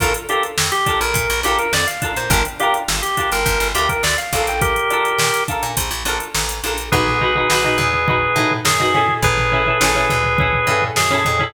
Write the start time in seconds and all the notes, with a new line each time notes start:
0.00 A#1 D4 F4 A4 A#4, kick, closed hi-hat
0.14 closed hi-hat
0.29 D4 F4 G4 A4 A#4, closed hi-hat
0.43 closed hi-hat
0.58 F2, snare
0.72 G4, closed hi-hat
0.86 D4 F4 A4 A#4, kick, closed hi-hat
1.01 A#1 A#4, closed hi-hat
1.14 A#2, kick, closed hi-hat
1.30 A#1, closed hi-hat
1.43 A#1 D4 F4 G4 A4, closed hi-hat
1.48 A#4
1.59 A#4, closed hi-hat
1.73 F2 D5, snare
1.87 F5, closed hi-hat
2.02 D4 F4 A4 A#4, kick, closed hi-hat
2.16 A#2 C5, closed hi-hat
2.30 G1 D4 F4 G4 A#4, kick, closed hi-hat
2.34 A#4
2.45 closed hi-hat
2.60 D4 F4 G4 A#4, closed hi-hat
2.74 closed hi-hat
2.88 G1, snare
3.02 G4, closed hi-hat
3.17 D4 F4 G4 A#4, kick, closed hi-hat
3.32 G1 A#4, closed hi-hat
3.46 G1, kick, closed hi-hat
3.60 G1, snare, closed hi-hat
3.75 D2 D4 F4 G4, closed hi-hat
3.79 A#4
3.89 A#4, kick, closed hi-hat
4.03 D2 D5, snare
4.18 F5, closed hi-hat
4.33 A#1 D4 F4 A4 A#4, kick, closed hi-hat
4.47 G5, closed hi-hat
4.62 G4 A#4, kick, closed hi-hat
4.76 closed hi-hat
4.90 D4 F4 A4 A#4, closed hi-hat
5.05 closed hi-hat
5.18 A#2, snare
5.34 closed hi-hat
5.48 D4 F4 A4 A#4, kick, closed hi-hat
5.63 A#2, closed hi-hat
5.77 A#1, kick, closed hi-hat
5.91 A#1, closed hi-hat
6.05 A#1 D4 F4 A4 A#4, closed hi-hat
6.20 closed hi-hat
6.34 A1, snare
6.49 closed hi-hat
6.63 A#1 D4 F4 A4 A#4, closed hi-hat
6.78 closed hi-hat
6.92 B1 D#4 F#4 G#4 B4, kick, floor tom
7.07 snare, floor tom
7.21 D#4 F#4 B4, floor tom
7.35 D#4 F#4 B4, floor tom
7.50 B1 D#4 F#4 B4, snare
7.64 D#4 F#4 B4, floor tom
7.78 E2, snare, floor tom
7.93 floor tom
8.08 D#4 F#4 B4, kick, floor tom
8.36 A2 D#4 F#4 B4, floor tom
8.51 floor tom
8.65 F#2 G#4, snare
8.80 D#4 F#4 B4, floor tom
8.94 C#4 E4 G#4 A4, snare, floor tom
9.08 floor tom
9.22 A1 G#4 B4, kick, floor tom
9.37 snare, floor tom
9.52 C#4 E4 G#4 A4, floor tom
9.66 C#4 E4 G#4 A4, floor tom
9.81 A1 C#4 E4 G#4 A4, snare
9.95 C#4 E4 G#4 A4, floor tom
10.10 D2, floor tom
10.24 floor tom
10.38 C#4 E4 G#4 A4, kick, floor tom
10.53 floor tom
10.67 G2 C#4 E4 G#4 A4, floor tom
10.82 floor tom
10.96 F#2 G#4, snare
11.10 C#4 E4 G#4 A4, floor tom
11.25 F2, floor tom
11.39 C#4 E4 G#4 A4, floor tom